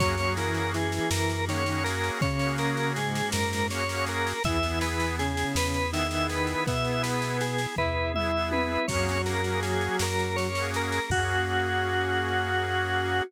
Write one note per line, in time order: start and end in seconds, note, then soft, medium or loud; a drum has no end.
0.00 1.00 F#2 loud
0.00 0.32 F#3 medium
0.00 4.40 A#3 medium
0.00 0.15 A#3 loud
0.00 4.40 C#4 medium
0.00 0.15 C#4 loud
0.00 0.32 F#4 medium
0.00 4.40 F#4 medium
0.00 0.15 F#4 loud
0.00 4.40 G#4 medium
0.00 0.34 C#5 medium
0.00 kick loud
0.00 snare loud
0.06 0.15 G#4 loud
0.18 0.77 A#3 medium
0.18 0.77 C#4 loud
0.18 snare medium
0.22 0.77 F#4 medium
0.22 0.77 G#4 medium
0.37 0.68 E3 medium
0.37 0.68 E4 medium
0.37 0.71 A#4 medium
0.37 snare loud
0.54 snare medium
0.74 1.41 E3 medium
0.74 1.41 E4 medium
0.74 1.10 G#4 medium
0.74 snare medium
0.92 snare medium
1.11 2.11 F#2 loud
1.11 1.45 A#4 medium
1.11 snare loud
1.30 snare medium
1.48 1.82 D#3 medium
1.48 1.64 A#3 loud
1.48 1.64 C#4 loud
1.48 1.82 D#4 medium
1.48 1.83 C#5 medium
1.48 snare loud
1.53 1.64 F#4 medium
1.53 1.64 G#4 medium
1.66 2.25 A#3 medium
1.66 2.25 C#4 loud
1.66 2.25 F#4 loud
1.66 snare medium
1.72 2.25 G#4 medium
1.84 2.18 A#4 medium
1.84 snare loud
2.03 snare medium
2.21 3.22 C#3 medium
2.21 2.88 C#3 medium
2.21 2.88 C#4 medium
2.21 2.56 C#5 medium
2.21 kick loud
2.21 snare medium
2.39 2.99 A#3 loud
2.39 2.99 C#4 loud
2.39 snare medium
2.44 2.99 F#4 loud
2.44 2.99 G#4 loud
2.58 2.93 A#4 medium
2.58 snare medium
2.77 snare medium
2.96 3.68 G#2 medium
2.96 3.68 G#3 medium
2.96 3.30 G#4 medium
2.96 snare medium
3.15 snare loud
3.32 4.34 F#2 medium
3.32 3.67 A#4 medium
3.32 snare loud
3.53 snare loud
3.69 3.84 A#3 medium
3.69 3.84 C#4 medium
3.69 3.84 F#4 loud
3.69 4.05 C#5 medium
3.69 snare loud
3.75 3.84 G#4 medium
3.89 4.33 A#3 loud
3.89 4.33 C#4 medium
3.89 4.33 F#4 medium
3.89 snare medium
3.94 4.33 G#4 loud
4.06 4.43 A#4 medium
4.06 snare medium
4.27 snare medium
4.44 5.45 E2 loud
4.44 5.15 E3 medium
4.44 4.58 B3 loud
4.44 8.85 B3 medium
4.44 5.15 E4 medium
4.44 4.58 E4 loud
4.44 8.85 E4 medium
4.44 8.85 G#4 medium
4.44 4.58 G#4 loud
4.44 4.79 E5 medium
4.44 kick loud
4.44 snare medium
4.63 5.23 B3 loud
4.63 5.23 E4 medium
4.63 snare medium
4.67 5.23 G#4 loud
4.81 5.16 B4 medium
4.81 snare loud
5.00 snare medium
5.19 5.83 C#3 medium
5.19 5.83 C#4 medium
5.19 5.53 G#4 medium
5.19 snare medium
5.37 snare medium
5.55 6.55 E2 medium
5.55 5.91 B4 medium
5.55 snare loud
5.74 snare medium
5.92 6.61 D#3 medium
5.92 6.07 B3 loud
5.92 6.61 D#4 medium
5.92 6.07 E4 loud
5.92 6.07 G#4 loud
5.92 6.27 E5 medium
5.92 snare loud
6.11 6.71 B3 loud
6.11 6.71 E4 loud
6.11 snare medium
6.15 6.71 G#4 medium
6.29 6.64 B4 medium
6.29 snare medium
6.47 snare medium
6.67 7.67 B2 medium
6.67 7.56 B3 medium
6.67 7.56 B4 medium
6.67 7.02 E5 medium
6.67 kick loud
6.67 snare loud
6.84 7.43 B3 loud
6.84 7.43 E4 medium
6.84 7.43 G#4 medium
6.84 snare medium
7.03 7.37 B4 medium
7.03 snare loud
7.22 snare medium
7.41 7.75 G#4 medium
7.41 snare loud
7.58 snare medium
7.76 8.78 E2 medium
7.76 8.09 E4 medium
7.76 8.12 B4 medium
7.76 8.09 E5 medium
7.76 kick medium
7.76 floor tom loud
8.14 8.31 B3 medium
8.14 8.86 E4 medium
8.14 8.86 E5 medium
8.14 8.50 E5 medium
8.14 mid tom loud
8.18 8.31 E4 medium
8.18 8.31 G#4 loud
8.35 8.79 B3 medium
8.35 8.79 E4 medium
8.35 8.79 G#4 medium
8.51 8.87 B4 medium
8.51 high tom loud
8.88 9.89 F#2 loud
8.88 10.47 F#3 medium
8.88 9.18 A#3 loud
8.88 9.99 A#3 medium
8.88 9.99 C#4 medium
8.88 9.18 C#4 loud
8.88 9.99 F#4 medium
8.88 10.47 F#4 medium
8.88 9.99 G#4 medium
8.88 9.22 C#5 medium
8.88 kick loud
8.88 snare loud
8.88 crash loud
8.92 9.18 F#4 loud
8.92 9.18 G#4 loud
9.09 snare medium
9.26 9.41 A#3 loud
9.26 9.41 C#4 loud
9.26 9.60 A#4 medium
9.26 snare loud
9.30 9.41 F#4 medium
9.30 9.41 G#4 medium
9.44 10.05 A#3 medium
9.44 10.05 C#4 loud
9.44 snare medium
9.49 10.05 F#4 medium
9.49 10.05 G#4 loud
9.63 9.97 G#4 medium
9.63 snare medium
9.81 snare medium
9.99 11.00 F#2 medium
9.99 11.10 A#3 medium
9.99 11.10 C#4 medium
9.99 11.10 G#4 medium
9.99 11.10 A#4 medium
9.99 10.36 A#4 medium
9.99 snare loud
10.19 snare medium
10.36 10.70 C#5 medium
10.36 snare medium
10.55 11.00 A#3 medium
10.55 11.00 C#4 medium
10.55 11.00 F#4 medium
10.55 snare medium
10.61 11.00 G#4 loud
10.74 11.10 A#4 medium
10.74 snare medium
10.92 snare medium
11.10 13.22 F#2 loud
11.10 13.23 A#3 medium
11.10 13.23 A#3 loud
11.10 13.23 C#4 loud
11.10 13.22 F#4 loud
11.10 13.23 F#4 loud
11.10 13.23 G#4 medium
11.10 kick loud
11.10 crash loud
11.15 13.23 F#4 loud
11.15 13.23 G#4 loud